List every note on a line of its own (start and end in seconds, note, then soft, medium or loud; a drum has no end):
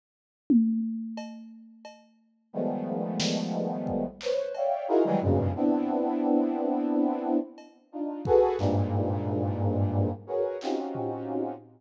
0.50 high tom loud
1.17 cowbell medium
1.85 cowbell medium
2.53 4.05 D#3 medium
2.53 4.05 F3 medium
2.53 4.05 G3 medium
2.53 4.05 G#3 medium
2.53 4.05 A3 medium
2.53 4.05 B3 medium
3.20 snare loud
3.87 kick medium
4.21 4.53 B4 medium
4.21 4.53 C5 medium
4.21 4.53 C#5 medium
4.21 clap medium
4.54 4.86 C#5 medium
4.54 4.86 D5 medium
4.54 4.86 E5 medium
4.54 4.86 F5 medium
4.54 4.86 G5 medium
4.54 cowbell medium
4.88 5.03 D#4 loud
4.88 5.03 E4 loud
4.88 5.03 F4 loud
4.88 5.03 F#4 loud
4.88 5.03 G#4 loud
4.88 5.03 A#4 loud
5.05 5.20 D#3 loud
5.05 5.20 E3 loud
5.05 5.20 F#3 loud
5.05 5.20 G3 loud
5.05 5.20 G#3 loud
5.21 5.52 F#2 medium
5.21 5.52 G2 medium
5.21 5.52 G#2 medium
5.21 5.52 A#2 medium
5.21 5.52 B2 medium
5.21 5.52 C#3 medium
5.55 7.37 B3 medium
5.55 7.37 C4 medium
5.55 7.37 D4 medium
5.55 7.37 E4 medium
7.58 cowbell medium
7.92 8.22 D4 soft
7.92 8.22 D#4 soft
7.92 8.22 F4 soft
8.25 8.56 F#4 loud
8.25 8.56 G#4 loud
8.25 8.56 A4 loud
8.25 8.56 B4 loud
8.25 kick medium
8.58 10.10 G2 loud
8.58 10.10 G#2 loud
8.58 10.10 A#2 loud
8.58 clap medium
10.27 10.57 F#4 medium
10.27 10.57 G#4 medium
10.27 10.57 A#4 medium
10.27 10.57 B4 medium
10.27 10.57 C#5 medium
10.61 11.53 C4 medium
10.61 11.53 C#4 medium
10.61 11.53 D#4 medium
10.61 11.53 F4 medium
10.61 11.53 F#4 medium
10.61 11.53 G4 medium
10.61 clap medium
10.95 floor tom medium